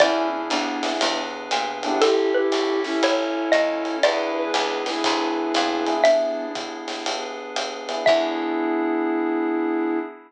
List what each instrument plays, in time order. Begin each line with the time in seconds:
0.00 electric bass (finger) E2, pad 5 (bowed) B3 D4 E4 G#4, electric piano 1 B3 D4 E4 G#4, flute C#4 E4, xylophone D5, kick, ride
0.49 electric bass (finger) D2, flute B3 D4, hi-hat pedal, ride
0.83 electric piano 1 B3 D4 E4 G#4, snare, ride
1.01 electric bass (finger) E2, pad 5 (bowed) B3 D4 G#4 B4, ride
1.51 electric bass (finger) A#2, hi-hat pedal, ride
1.83 flute B3 D4, electric piano 1 C#4 E4 G4 A4, ride
2.01 electric bass (finger) A1, pad 5 (bowed) C#4 E4 G4 A4, flute E4 G4, xylophone A4, ride
2.34 flute E4 G4, xylophone B4
2.52 electric bass (finger) B1, hi-hat pedal, ride
2.84 flute C#4 E4, snare
3.02 electric bass (finger) A1, pad 5 (bowed) C#4 E4 A4 C#5, xylophone C#5, ride
3.52 electric bass (finger) D#2, xylophone D#5, hi-hat pedal, ride
3.85 ride
4.03 electric bass (finger) E2, pad 5 (bowed) B3 D4 E4 G#4, electric piano 1 B3 D4 E4 G#4, flute G#4 B4, xylophone D5, ride
4.36 flute G#4 B4
4.54 electric bass (finger) C#2, hi-hat pedal, ride
4.86 flute E4 G#4, snare, ride
5.04 electric bass (finger) D2, pad 5 (bowed) B3 D4 G#4 B4, kick, ride
5.54 electric bass (finger) F2, hi-hat pedal, ride
5.86 electric piano 1 B3 D4 E4 G#4, ride
6.04 flute B3 D4, pad 5 (bowed) B3 D4 E4 G#4, xylophone E5, ride
6.55 kick, hi-hat pedal, ride
6.88 snare, ride
7.06 pad 5 (bowed) B3 D4 G#4 B4, ride
7.56 hi-hat pedal, ride
7.89 electric piano 1 B3 D4 E4 G#4, ride
8.06 electric bass (finger) E2, pad 5 (bowed) B3 D4 E4 G#4, electric piano 1 B3 D4 E4 G#4, flute E4, xylophone E5, kick, crash